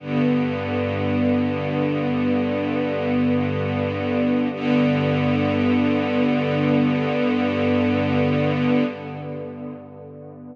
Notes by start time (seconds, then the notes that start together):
0.00 G2 D3 B3
4.53 G2 D3 B3